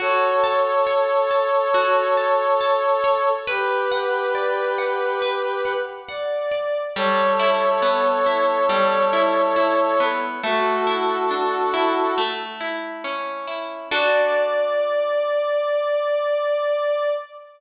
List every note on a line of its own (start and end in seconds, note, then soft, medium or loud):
0.00 1.74 F#4 loud
0.00 3.29 A4 medium
0.00 3.29 C#5 loud
0.44 1.30 A5 medium
0.87 3.03 C#5 medium
1.31 2.17 A5 medium
1.74 3.39 F#4 medium
2.17 2.60 A5 medium
2.61 3.43 A5 medium
3.04 3.45 C#5 medium
3.47 5.72 G4 medium
3.47 5.21 B4 loud
3.47 5.72 B4 medium
3.92 4.78 F#5 medium
4.35 6.51 D5 medium
4.78 5.65 F#5 medium
5.22 6.87 B4 medium
5.65 6.08 F#5 medium
6.09 6.80 D5 medium
6.09 6.91 F#5 medium
6.51 6.93 D5 medium
6.95 8.69 G3 medium
6.95 10.04 A4 medium
6.95 10.04 C#5 loud
7.39 8.26 E4 medium
7.82 10.00 B3 medium
8.26 9.12 E4 medium
8.69 10.35 G3 medium
9.13 9.56 E4 medium
9.56 10.39 E4 medium
10.00 10.41 B3 medium
10.43 12.09 A3 loud
10.43 12.18 F#4 medium
10.43 12.18 A4 medium
10.87 11.73 E4 medium
11.31 12.13 D4 medium
11.74 12.15 E4 medium
12.18 13.83 A3 medium
12.61 13.47 E4 medium
13.04 13.87 C#4 medium
13.47 13.89 E4 medium
13.91 17.09 D4 loud
13.91 17.09 F#4 loud
13.91 17.09 A4 loud
13.91 17.09 D5 loud